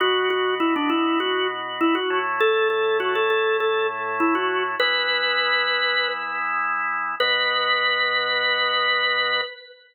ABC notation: X:1
M:4/4
L:1/16
Q:1/4=100
K:Bdor
V:1 name="Drawbar Organ"
F2 F2 E D E2 F2 z2 E F2 z | A2 A2 F A A2 A2 z2 E F2 z | B10 z6 | B16 |]
V:2 name="Drawbar Organ"
[B,,B,F]14 [A,,A,E]2- | [A,,A,E]16 | [E,B,E]16 | [B,,B,F]16 |]